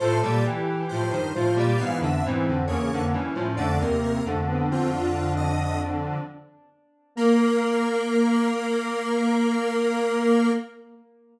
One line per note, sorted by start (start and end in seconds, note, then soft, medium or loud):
0.00 0.21 A2 medium
0.00 0.21 F3 medium
0.00 0.38 A4 medium
0.00 0.20 C5 loud
0.22 0.44 A#2 medium
0.22 0.44 G3 medium
0.22 0.44 D5 medium
0.44 0.86 E3 medium
0.44 1.18 G4 medium
0.89 1.12 A2 medium
0.89 1.12 F3 medium
0.89 1.10 C5 medium
1.11 1.33 G2 medium
1.11 1.33 D#3 medium
1.11 1.32 C5 medium
1.34 1.57 A2 medium
1.34 1.57 F3 medium
1.34 1.71 F4 medium
1.34 1.55 C5 medium
1.56 1.77 A#2 medium
1.56 1.77 G3 medium
1.56 1.80 D5 medium
1.77 2.01 G#2 medium
1.77 2.01 E3 medium
1.77 2.20 B3 medium
1.77 1.99 F5 medium
2.00 2.22 F2 medium
2.00 2.22 D3 medium
2.00 2.24 E5 medium
2.24 2.46 G#2 medium
2.24 2.46 E3 medium
2.24 2.66 C4 medium
2.48 2.69 F2 medium
2.48 2.69 D3 medium
2.68 2.89 E2 medium
2.68 2.89 C#3 medium
2.68 2.90 A#3 medium
2.68 3.04 C#5 medium
2.91 3.14 F2 medium
2.91 3.14 D3 medium
2.91 3.13 A#3 medium
3.13 3.34 G2 medium
3.13 3.34 E3 medium
3.13 3.35 C#4 medium
3.35 3.56 A2 medium
3.35 3.56 F3 medium
3.35 3.57 C#4 medium
3.57 3.78 F2 medium
3.57 3.78 D3 medium
3.57 3.79 A3 loud
3.57 3.78 D5 medium
3.80 4.21 D#2 medium
3.80 4.21 C3 medium
3.80 4.18 A#3 medium
3.80 4.01 A#4 medium
4.04 4.25 A#4 medium
4.25 6.18 F2 medium
4.25 6.18 D3 medium
4.25 4.46 A3 medium
4.48 4.70 B3 medium
4.69 4.91 C4 medium
4.69 4.90 F4 medium
4.90 6.24 D4 medium
4.90 5.33 F4 medium
5.37 5.80 D#5 medium
7.15 10.50 A#3 loud
7.15 10.51 A#3 loud
7.15 10.51 A#4 loud